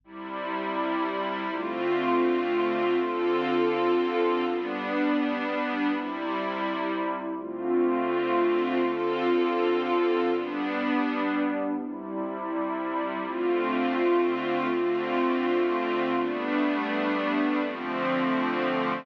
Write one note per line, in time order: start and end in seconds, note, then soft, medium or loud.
0.04 1.49 C3 medium
0.04 1.49 G3 loud
0.04 1.49 E4 medium
1.50 2.95 D3 medium
1.50 2.95 A3 medium
1.50 2.95 C4 medium
1.50 2.95 F4 medium
2.96 4.41 D3 medium
2.96 4.41 C4 medium
2.96 4.41 F4 medium
2.96 4.41 A4 medium
4.43 5.88 G3 medium
4.43 5.88 B3 medium
4.43 5.88 D4 medium
5.89 7.34 C3 medium
5.89 7.34 G3 loud
5.89 7.34 E4 medium
7.35 8.80 D3 medium
7.35 8.80 A3 medium
7.35 8.80 C4 medium
7.35 8.80 F4 medium
8.82 10.26 D3 medium
8.82 10.26 C4 medium
8.82 10.26 F4 medium
8.82 10.26 A4 medium
10.28 11.73 G3 medium
10.28 11.73 B3 medium
10.28 11.73 D4 medium
11.74 13.19 C3 medium
11.74 13.19 G3 loud
11.74 13.19 E4 medium
13.20 14.65 D3 medium
13.20 14.65 A3 medium
13.20 14.65 C4 medium
13.20 14.65 F4 medium
14.67 16.12 D3 medium
14.67 16.12 A3 medium
14.67 16.12 C4 medium
14.67 16.12 F4 medium
16.13 17.58 G3 medium
16.13 17.58 A3 medium
16.13 17.58 B3 medium
16.13 17.58 D4 medium
17.60 19.05 D3 medium
17.60 19.05 F3 loud
17.60 19.05 A3 medium
17.60 19.05 C4 loud